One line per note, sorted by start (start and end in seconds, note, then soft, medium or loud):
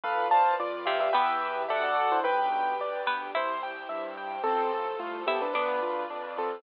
0.03 0.53 B1 medium
0.03 1.13 F4 medium
0.03 0.27 A4 medium
0.03 0.28 B4 loud
0.03 1.13 B4 medium
0.03 1.13 D5 medium
0.03 0.27 F5 medium
0.31 0.54 C5 medium
0.31 0.56 F5 medium
0.31 0.54 A5 medium
0.59 1.09 F2 medium
0.59 0.86 F4 medium
0.59 0.86 D5 medium
0.59 0.85 D5 medium
0.85 1.09 C3 medium
0.85 1.09 C4 medium
0.85 0.99 G4 medium
0.85 0.99 E5 medium
0.85 1.10 F5 medium
1.00 1.13 G4 medium
1.00 1.13 E5 medium
1.13 1.65 E2 loud
1.13 2.10 B3 medium
1.13 1.70 E4 medium
1.13 1.65 G4 medium
1.13 1.70 G4 medium
1.13 1.62 B4 medium
1.13 2.10 B4 medium
1.13 1.70 B4 medium
1.13 1.62 E5 medium
1.13 1.65 E5 medium
1.13 1.62 G5 medium
1.68 2.20 D2 medium
1.68 2.22 D4 medium
1.68 2.22 F#4 medium
1.68 1.82 G4 medium
1.68 2.22 A4 loud
1.68 2.19 A4 loud
1.68 2.19 D5 loud
1.68 1.82 E5 medium
1.68 2.19 F#5 loud
1.83 1.96 F#4 medium
1.83 1.96 D5 medium
2.12 2.25 E4 medium
2.12 2.25 C5 medium
2.24 2.74 B1 medium
2.24 3.35 D4 medium
2.24 3.34 G4 medium
2.24 2.49 B4 loud
2.24 3.01 B4 medium
2.24 3.35 B4 medium
2.24 3.01 G5 medium
2.52 2.77 G5 medium
2.79 3.29 D2 medium
2.79 3.06 D5 medium
3.06 3.32 B3 medium
3.06 3.32 B4 medium
3.06 3.31 G5 medium
3.35 3.84 C2 medium
3.35 4.30 E4 medium
3.35 4.44 E4 loud
3.35 4.44 G4 medium
3.35 4.44 C5 medium
3.35 3.61 C5 loud
3.35 4.30 E5 medium
3.63 3.88 G5 medium
3.89 4.39 G2 medium
3.89 4.14 E5 medium
4.17 4.42 G5 medium
4.44 4.95 A1 medium
4.44 4.88 C4 medium
4.44 4.71 C4 loud
4.44 5.53 F4 medium
4.44 4.88 A4 medium
4.44 5.53 A4 loud
4.44 5.53 C5 medium
4.74 4.99 A4 medium
4.99 5.49 C2 medium
4.99 5.22 A3 medium
4.99 5.22 F4 medium
4.99 5.24 F4 medium
5.27 5.40 B3 medium
5.27 5.52 E4 medium
5.27 5.40 G4 medium
5.27 5.52 A4 medium
5.27 5.52 E5 medium
5.42 5.53 D4 medium
5.42 5.53 B4 medium
5.53 6.05 D2 medium
5.53 5.80 B3 loud
5.53 6.03 D4 medium
5.53 6.61 D4 medium
5.53 6.62 F4 medium
5.53 6.03 B4 medium
5.53 6.62 B4 medium
5.53 6.61 D5 medium
5.53 6.62 D5 medium
5.82 6.07 F4 medium
6.10 6.60 F2 medium
6.10 6.35 D4 medium
6.37 6.62 C4 medium
6.37 6.62 F4 medium
6.37 6.62 A4 medium